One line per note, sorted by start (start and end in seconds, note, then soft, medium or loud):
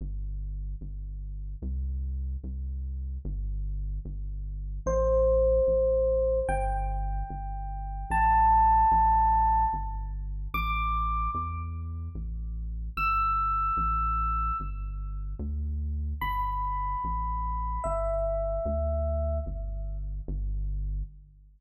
0.01 0.75 G1 medium
0.81 1.56 G1 medium
1.62 2.37 C2 medium
2.44 3.18 C2 medium
3.25 3.99 G1 loud
4.05 4.80 G1 medium
4.86 5.61 A1 loud
4.86 6.40 C5 medium
5.67 6.42 A1 medium
6.49 7.23 G1 loud
6.49 8.10 G5 medium
7.30 8.05 G1 medium
8.10 8.85 A1 loud
8.10 9.65 A5 medium
8.91 9.66 A1 medium
9.73 10.48 G1 medium
10.54 11.28 A1 medium
10.54 11.31 D6 medium
11.34 12.09 E2 medium
12.15 12.90 A1 medium
12.97 13.71 G1 medium
12.97 14.57 E6 medium
13.77 14.52 A1 medium
14.60 15.35 G1 medium
15.39 16.14 D2 medium
16.21 16.96 G1 medium
16.21 17.73 B5 medium
17.04 17.79 A1 medium
17.84 18.60 G1 medium
17.84 19.38 E5 medium
18.65 19.40 D2 loud
19.46 20.21 G1 medium
20.28 21.03 G1 loud